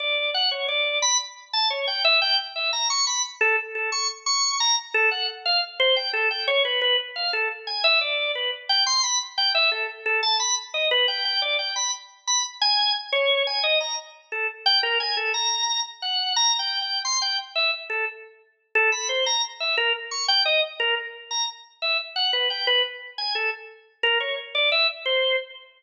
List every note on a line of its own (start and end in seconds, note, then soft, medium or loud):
0.00 0.30 D5 medium
0.34 0.50 F#5 medium
0.51 0.67 C#5 medium
0.68 0.99 D5 medium
1.02 1.18 B5 medium
1.53 1.69 A5 medium
1.70 1.86 C#5 medium
1.87 2.03 G5 medium
2.05 2.20 E5 loud
2.22 2.37 G5 loud
2.56 2.71 E5 medium
2.73 2.88 A#5 medium
2.90 3.05 C#6 medium
3.07 3.22 B5 medium
3.41 3.56 A4 loud
3.75 3.90 A4 medium
3.92 4.07 C#6 medium
4.26 4.57 C#6 medium
4.60 4.76 A#5 loud
4.94 5.10 A4 loud
5.11 5.27 F#5 medium
5.46 5.61 F5 medium
5.80 5.95 C5 loud
5.96 6.12 G5 medium
6.13 6.29 A4 medium
6.31 6.46 G5 medium
6.48 6.63 C#5 loud
6.65 6.80 B4 medium
6.82 6.97 B4 loud
7.16 7.31 F5 medium
7.33 7.49 A4 medium
7.67 7.82 G#5 medium
7.84 7.99 E5 loud
8.01 8.32 D5 medium
8.35 8.51 B4 medium
8.69 8.85 G5 loud
8.87 9.02 C6 loud
9.03 9.19 B5 medium
9.38 9.53 G5 medium
9.55 9.70 E5 loud
9.72 9.87 A4 medium
10.06 10.21 A4 medium
10.23 10.38 A5 medium
10.40 10.55 B5 medium
10.74 10.89 D#5 medium
10.91 11.07 B4 loud
11.08 11.23 G5 medium
11.25 11.40 G5 medium
11.42 11.57 D5 medium
11.59 11.74 G5 medium
11.76 11.91 B5 medium
12.27 12.43 B5 medium
12.62 12.92 G#5 loud
13.12 13.43 C#5 loud
13.47 13.62 G#5 medium
13.63 13.79 D#5 loud
13.81 13.96 A#5 medium
14.32 14.47 A4 medium
14.66 14.81 G5 loud
14.83 14.98 A#4 loud
15.00 15.15 G#5 medium
15.17 15.32 A4 medium
15.34 15.80 A#5 medium
16.02 16.33 F#5 medium
16.36 16.57 A#5 loud
16.59 16.79 G5 medium
16.82 17.03 G5 medium
17.05 17.20 C6 medium
17.22 17.37 G5 medium
17.56 17.71 E5 medium
17.90 18.05 A4 medium
18.75 18.90 A4 loud
18.92 19.08 B5 medium
19.09 19.24 C5 medium
19.26 19.42 A#5 medium
19.60 19.76 E5 medium
19.77 19.93 A#4 loud
20.11 20.27 C#6 medium
20.28 20.44 G5 loud
20.45 20.61 D#5 loud
20.80 20.95 A#4 loud
21.31 21.46 A#5 medium
21.82 21.97 E5 medium
22.16 22.31 F#5 medium
22.33 22.48 B4 medium
22.50 22.65 G5 soft
22.67 22.83 B4 loud
23.18 23.33 G#5 medium
23.35 23.50 A4 medium
24.03 24.19 A#4 loud
24.20 24.36 C#5 medium
24.55 24.70 D5 medium
24.72 24.87 E5 loud
25.06 25.36 C5 medium